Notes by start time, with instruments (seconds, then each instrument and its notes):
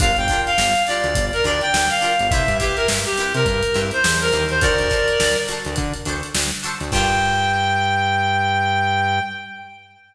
0.00 synth bass 1 G1, pizzicato strings D4 F4 G4 A#4, clarinet F5, kick, closed hi-hat
0.17 synth bass 1 G1, clarinet G5, closed hi-hat
0.28 pizzicato strings D4 F4 G4, kick, closed hi-hat
0.33 pizzicato strings A#4
0.46 clarinet F5, closed hi-hat
0.58 synth bass 1 G1, snare
0.75 closed hi-hat
0.87 pizzicato strings D4 F4 G4, clarinet D5, closed hi-hat
0.91 pizzicato strings A#4
1.04 synth bass 1 D2, closed hi-hat
1.15 synth bass 1 G1, kick, closed hi-hat
1.33 clarinet A#4, closed hi-hat
1.44 synth bass 1 D2, pizzicato strings D4 F4 G4 A#4, clarinet D5, closed hi-hat
1.61 clarinet G5, closed hi-hat
1.73 synth bass 1 D2, snare
1.89 clarinet F5, snare, closed hi-hat
2.01 pizzicato strings D4 F4 G4 A#4, closed hi-hat
2.19 synth bass 1 G1, closed hi-hat
2.30 synth bass 1 C2, pizzicato strings C4 E4 G4, clarinet E5, kick, closed hi-hat
2.35 pizzicato strings B4
2.48 synth bass 1 G2, closed hi-hat
2.59 pizzicato strings C4 E4 G4 B4, clarinet G4, kick, closed hi-hat
2.76 clarinet A#4, closed hi-hat
2.88 synth bass 1 G2, snare
3.05 clarinet G4, closed hi-hat
3.18 pizzicato strings C4 E4 G4 B4, closed hi-hat
3.34 synth bass 1 C3, clarinet A#4, closed hi-hat
3.46 synth bass 1 G2, kick, closed hi-hat
3.63 closed hi-hat
3.74 synth bass 1 G2, pizzicato strings C4 E4 G4 B4, snare, closed hi-hat
3.91 clarinet C5, closed hi-hat
4.04 synth bass 1 E2, snare
4.21 clarinet A#4, closed hi-hat
4.32 synth bass 1 D#2, pizzicato strings C4 E4 G4 B4, closed hi-hat
4.49 clarinet C5, closed hi-hat
4.61 synth bass 1 D2, pizzicato strings D4 F#4 A4, clarinet A#4 D5, kick, closed hi-hat
4.65 pizzicato strings C5
4.78 synth bass 1 D2, closed hi-hat
4.90 pizzicato strings D4 F#4 A4 C5, kick, snare, closed hi-hat
5.08 closed hi-hat
5.20 synth bass 1 D2, snare
5.36 closed hi-hat
5.48 pizzicato strings D4 F#4 A4 C5, closed hi-hat
5.65 synth bass 1 D2, closed hi-hat
5.76 synth bass 1 D3, kick, closed hi-hat
5.94 closed hi-hat
6.05 synth bass 1 D2, pizzicato strings D4 F#4 A4, closed hi-hat
6.09 pizzicato strings C5
6.23 closed hi-hat
6.34 synth bass 1 D2, snare
6.51 closed hi-hat
6.63 pizzicato strings D4 F#4 A4 C5, closed hi-hat
6.81 synth bass 1 D2, closed hi-hat
6.92 synth bass 1 G2, pizzicato strings D4 F4 G4 A#4, clarinet G5, kick, crash